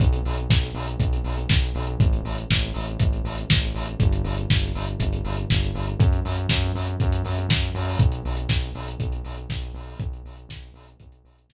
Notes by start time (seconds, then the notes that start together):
0.00 B1, kick, closed hi-hat
0.13 closed hi-hat
0.25 B1, open hi-hat
0.38 closed hi-hat
0.50 B1, kick, snare
0.63 closed hi-hat
0.75 B1, open hi-hat
0.88 closed hi-hat
1.00 B1, kick, closed hi-hat
1.13 closed hi-hat
1.24 B1, open hi-hat
1.38 closed hi-hat
1.49 B1, kick, snare
1.62 closed hi-hat
1.75 B1, open hi-hat
1.87 closed hi-hat
1.99 A1, kick, closed hi-hat
2.13 closed hi-hat
2.24 A1, open hi-hat
2.38 closed hi-hat
2.50 A1, kick, snare
2.63 closed hi-hat
2.74 A1, open hi-hat
2.87 closed hi-hat
2.99 A1, kick, closed hi-hat
3.13 closed hi-hat
3.24 A1, open hi-hat
3.38 closed hi-hat
3.50 A1, kick, snare
3.62 closed hi-hat
3.74 A1, open hi-hat
3.88 closed hi-hat
4.00 G1, kick, closed hi-hat
4.12 closed hi-hat
4.24 G1, open hi-hat
4.37 closed hi-hat
4.50 G1, kick, snare
4.63 closed hi-hat
4.75 G1, open hi-hat
4.87 closed hi-hat
5.00 G1, kick, closed hi-hat
5.13 closed hi-hat
5.24 G1, open hi-hat
5.37 closed hi-hat
5.50 G1, kick, snare
5.63 closed hi-hat
5.74 G1, open hi-hat
5.87 closed hi-hat
5.99 F#2, kick, closed hi-hat
6.13 closed hi-hat
6.25 F#2, open hi-hat
6.38 closed hi-hat
6.49 F#2, kick, snare
6.63 closed hi-hat
6.75 F#2, open hi-hat
6.87 closed hi-hat
7.00 F#2, kick, closed hi-hat
7.12 closed hi-hat
7.25 F#2, open hi-hat
7.38 closed hi-hat
7.49 F#2, kick, snare
7.62 closed hi-hat
7.74 F#2, open hi-hat
7.88 open hi-hat
7.99 B1, kick, closed hi-hat
8.12 closed hi-hat
8.25 B1, open hi-hat
8.37 closed hi-hat
8.49 B1, kick, snare
8.62 closed hi-hat
8.75 B1, open hi-hat
8.88 closed hi-hat
9.00 B1, kick, closed hi-hat
9.12 closed hi-hat
9.25 B1, open hi-hat
9.37 closed hi-hat
9.50 B1, kick, snare
9.62 closed hi-hat
9.74 B1, open hi-hat
9.88 open hi-hat
10.00 B1, kick, closed hi-hat
10.13 closed hi-hat
10.25 B1, open hi-hat
10.37 closed hi-hat
10.49 B1, kick, snare
10.63 closed hi-hat
10.74 B1, open hi-hat
10.88 closed hi-hat
11.00 B1, kick, closed hi-hat
11.12 closed hi-hat
11.25 B1, open hi-hat
11.38 closed hi-hat
11.49 B1, kick, snare